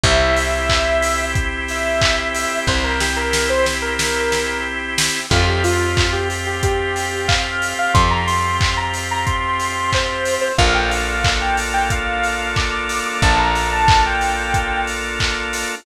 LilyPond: <<
  \new Staff \with { instrumentName = "Lead 2 (sawtooth)" } { \time 4/4 \key f \major \tempo 4 = 91 e''2 r8 e''4. | c''16 bes'16 g'16 bes'8 c''16 r16 bes'4~ bes'16 r4 | f'16 g'16 f'8. g'16 r16 g'16 g'4 f''8. f''16 | c'''16 bes''16 c'''8. bes''16 r16 bes''16 c'''4 c''8. c''16 |
f''16 g''16 f''8. g''16 r16 g''16 f''4 d'''8. d'''16 | a''16 bes''8 a''8 g''4~ g''16 r4. | }
  \new Staff \with { instrumentName = "Drawbar Organ" } { \time 4/4 \key f \major <c' e' g'>1~ | <c' e' g'>1 | <c' f' g'>1~ | <c' f' g'>1 |
<bes d' f' a'>1~ | <bes d' f' a'>1 | }
  \new Staff \with { instrumentName = "Electric Bass (finger)" } { \clef bass \time 4/4 \key f \major c,1 | c,1 | f,1 | f,1 |
bes,,1 | bes,,1 | }
  \new Staff \with { instrumentName = "Drawbar Organ" } { \time 4/4 \key f \major <c' e' g'>1~ | <c' e' g'>1 | <c' f' g'>1~ | <c' f' g'>1 |
<bes d' f' a'>1~ | <bes d' f' a'>1 | }
  \new DrumStaff \with { instrumentName = "Drums" } \drummode { \time 4/4 <hh bd>8 hho8 <hc bd>8 hho8 <hh bd>8 hho8 <hc bd>8 hho8 | bd8 sn8 sn8 sn8 sn8 sn8 r8 sn8 | <cymc bd>8 hho8 <hc bd>8 hho8 <hh bd>8 hho8 <hc bd>8 hho8 | <hh bd>8 hho8 <hc bd>8 hho8 <hh bd>8 hho8 <hc bd>8 hho8 |
<hh bd>8 hho8 <hc bd>8 hho8 <hh bd>8 hho8 <hc bd>8 hho8 | <hh bd>8 hho8 <hc bd>8 hho8 <hh bd>8 hho8 <hc bd>8 hho8 | }
>>